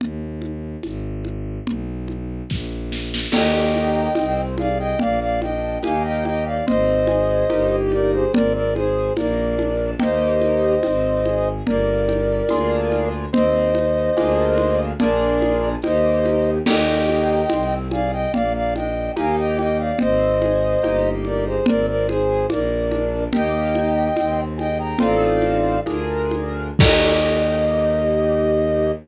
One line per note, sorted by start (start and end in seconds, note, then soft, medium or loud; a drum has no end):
0.00 0.76 D#2 medium
0.00 low conga medium
0.42 high conga soft
0.82 1.59 G#1 loud
0.82 tambourine medium
0.82 high conga medium
1.25 high conga soft
1.65 2.42 B1 medium
1.65 low conga medium
2.08 high conga soft
2.49 3.26 A#1 loud
2.49 kick medium
2.49 snare medium
2.92 snare medium
3.14 snare medium
3.32 4.08 D#2 loud
3.32 4.09 A#3 loud
3.32 4.09 D#4 loud
3.32 4.09 G4 loud
3.32 4.41 D#5 medium
3.32 4.41 G5 medium
3.32 crash medium
3.32 low conga medium
3.75 high conga medium
4.15 4.94 C2 loud
4.15 4.55 C4 medium
4.15 tambourine medium
4.15 high conga medium
4.58 4.96 G#4 medium
4.58 4.78 D5 medium
4.58 4.78 F5 medium
4.58 high conga medium
4.79 4.99 D#5 medium
4.79 4.99 G5 medium
4.99 5.78 A#1 loud
4.99 5.38 A#3 medium
4.99 5.20 D5 medium
4.99 5.20 F5 medium
4.99 low conga medium
5.21 5.40 D5 medium
5.21 5.40 F5 medium
5.42 5.79 D4 medium
5.42 5.78 D#5 medium
5.42 5.78 G5 medium
5.42 high conga medium
5.83 6.61 D#2 loud
5.83 6.58 A#3 loud
5.83 6.58 D#4 loud
5.83 6.58 G4 medium
5.83 6.03 F5 medium
5.83 6.03 G#5 medium
5.83 tambourine medium
5.83 high conga medium
6.04 6.24 D#5 medium
6.04 6.24 G5 medium
6.25 6.45 D#5 medium
6.25 6.45 G5 medium
6.25 high conga medium
6.46 6.66 D5 medium
6.46 6.66 F5 medium
6.67 7.44 G#1 loud
6.67 7.04 C4 medium
6.67 7.76 C5 medium
6.67 7.76 D#5 medium
6.67 low conga medium
7.07 7.46 G#4 medium
7.07 high conga medium
7.49 8.26 G1 loud
7.49 8.25 A#3 medium
7.49 8.25 D#4 medium
7.49 8.25 G4 medium
7.49 tambourine medium
7.49 high conga medium
7.92 8.12 A#4 medium
7.92 8.12 D5 medium
7.92 high conga medium
8.13 8.32 G#4 medium
8.13 8.32 C5 medium
8.33 9.10 G#1 loud
8.33 8.71 C4 medium
8.33 8.53 A#4 medium
8.33 8.53 D5 medium
8.33 low conga loud
8.54 8.74 A#4 medium
8.54 8.74 D5 medium
8.75 9.12 G#4 medium
8.75 9.13 G#4 medium
8.75 9.13 C5 medium
8.75 high conga medium
9.16 9.94 A#1 loud
9.16 9.55 A#3 loud
9.16 9.91 A#4 medium
9.16 9.91 D5 medium
9.16 tambourine medium
9.16 high conga medium
9.58 9.96 D4 medium
9.58 high conga medium
9.99 10.78 D#2 loud
9.99 10.75 A#3 loud
9.99 10.75 D#4 loud
9.99 10.75 G4 loud
9.99 11.49 C5 medium
9.99 11.49 D#5 medium
9.99 low conga medium
10.42 high conga medium
10.83 11.61 G#1 loud
10.83 11.22 C4 loud
10.83 tambourine medium
10.83 high conga medium
11.25 11.63 G#4 medium
11.25 high conga medium
11.65 12.42 G1 loud
11.65 12.05 A#3 medium
11.65 13.09 A#4 medium
11.65 13.09 D5 medium
11.65 low conga medium
12.08 12.45 G4 medium
12.08 high conga medium
12.49 13.27 D2 loud
12.49 13.25 A#3 medium
12.49 13.25 D4 loud
12.49 13.25 F4 loud
12.49 13.25 G#4 loud
12.49 tambourine medium
12.49 high conga medium
12.92 high conga medium
13.33 14.09 D#2 loud
13.33 13.70 C4 loud
13.33 14.81 C5 medium
13.33 14.81 D#5 medium
13.33 low conga medium
13.75 14.12 D#4 medium
13.75 high conga medium
14.17 14.93 D2 loud
14.17 14.92 A#3 loud
14.17 14.92 D4 medium
14.17 14.92 F4 loud
14.17 14.92 G#4 medium
14.17 tambourine medium
14.17 high conga medium
14.58 high conga medium
14.99 15.76 A#1 loud
14.99 15.75 A#3 loud
14.99 15.75 D4 loud
14.99 15.75 F4 medium
14.99 15.75 G#4 loud
14.99 15.69 A#4 medium
14.99 15.69 D5 medium
14.99 low conga medium
15.42 high conga medium
15.82 16.60 D#2 loud
15.82 16.58 A#3 medium
15.82 16.58 D#4 medium
15.82 16.58 G4 medium
15.82 16.51 C5 medium
15.82 16.51 D#5 medium
15.82 tambourine medium
15.82 high conga medium
16.26 high conga medium
16.66 17.44 D#2 loud
16.66 17.42 A#3 loud
16.66 17.42 D#4 loud
16.66 17.42 G4 loud
16.66 17.75 D#5 medium
16.66 17.75 G5 medium
16.66 crash medium
16.66 low conga medium
17.09 high conga medium
17.49 18.26 C2 loud
17.49 17.87 C4 medium
17.49 tambourine medium
17.49 high conga medium
17.91 18.30 G#4 medium
17.91 18.11 D5 medium
17.91 18.11 F5 medium
17.91 high conga medium
18.12 18.32 D#5 medium
18.12 18.32 G5 medium
18.33 19.10 A#1 loud
18.33 18.71 A#3 medium
18.33 18.53 D5 medium
18.33 18.53 F5 medium
18.33 low conga medium
18.54 18.74 D5 medium
18.54 18.74 F5 medium
18.75 19.13 D4 medium
18.75 19.12 D#5 medium
18.75 19.12 G5 medium
18.75 high conga medium
19.16 19.93 D#2 loud
19.16 19.91 A#3 loud
19.16 19.91 D#4 loud
19.16 19.91 G4 medium
19.16 19.36 F5 medium
19.16 19.36 G#5 medium
19.16 tambourine medium
19.16 high conga medium
19.38 19.57 D#5 medium
19.38 19.57 G5 medium
19.58 19.78 D#5 medium
19.58 19.78 G5 medium
19.58 high conga medium
19.79 19.99 D5 medium
19.79 19.99 F5 medium
19.99 20.76 G#1 loud
19.99 20.37 C4 medium
19.99 21.10 C5 medium
19.99 21.10 D#5 medium
19.99 low conga medium
20.41 20.79 G#4 medium
20.41 high conga medium
20.83 21.59 G1 loud
20.83 21.58 A#3 medium
20.83 21.58 D#4 medium
20.83 21.58 G4 medium
20.83 tambourine medium
20.83 high conga medium
21.25 21.45 A#4 medium
21.25 21.45 D5 medium
21.25 high conga medium
21.46 21.66 G#4 medium
21.46 21.66 C5 medium
21.66 22.45 G#1 loud
21.66 22.04 C4 medium
21.66 21.86 A#4 medium
21.66 21.86 D5 medium
21.66 low conga loud
21.87 22.07 A#4 medium
21.87 22.07 D5 medium
22.08 22.47 G#4 medium
22.08 22.46 G#4 medium
22.08 22.47 C5 medium
22.08 high conga medium
22.50 23.27 A#1 loud
22.50 22.87 A#3 loud
22.50 23.24 A#4 medium
22.50 23.24 D5 medium
22.50 tambourine medium
22.50 high conga medium
22.91 23.29 D4 medium
22.91 high conga medium
23.33 24.10 D#2 loud
23.33 24.08 A#3 loud
23.33 24.08 D#4 medium
23.33 24.08 G4 medium
23.33 24.41 D#5 medium
23.33 24.41 G5 loud
23.33 low conga medium
23.75 high conga medium
24.16 24.94 D#2 loud
24.16 24.53 C4 medium
24.16 tambourine medium
24.16 high conga medium
24.58 24.95 G#4 medium
24.58 24.78 D#5 medium
24.58 24.78 G5 medium
24.58 high conga soft
24.79 24.99 G5 medium
24.79 24.99 A#5 medium
24.99 25.78 A1 loud
24.99 25.77 C4 loud
24.99 25.77 D#4 loud
24.99 25.77 F4 medium
24.99 25.77 A4 medium
24.99 25.80 D5 medium
24.99 25.80 F5 medium
24.99 low conga medium
25.42 high conga soft
25.85 26.71 D2 loud
25.85 26.70 D4 medium
25.85 26.70 F4 medium
25.85 26.70 G#4 medium
25.85 26.70 A#4 medium
25.85 tambourine medium
25.85 high conga medium
26.31 high conga medium
26.79 28.91 D#2 loud
26.79 28.92 A#3 loud
26.79 28.92 D#4 loud
26.79 28.92 G4 loud
26.79 28.92 D#5 loud
26.79 kick loud
26.79 crash loud